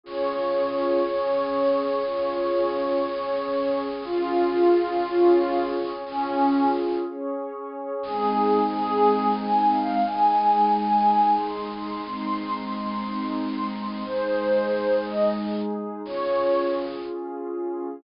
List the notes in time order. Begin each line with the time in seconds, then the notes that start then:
0.03 C#4 F4 G#4 C#5
1.03 C#4 G#4 C#5
2.03 C#4 F4 G#4 C#5
3.06 C#4 G#4 C#5
4.03 C#4 F4 G#4
5.03 C#4 G#4 C#5
6.05 C#4 F4 G#4
7.04 C#4 G#4 C#5
8.03 G#3 C4 D#4 G#4
8.71 G#4
9.38 G#5
9.72 F5
10.04 G#3 D#4 G#4 G#5
10.72 G#5
11.38 C6
11.73 C6
12.05 G#3 C4 D#4 C6
12.71 C6
13.39 C6
13.71 C6
14.04 G#3 D#4 G#4 C5
15.04 D#5
16.03 C#4 F4 G#4 C#5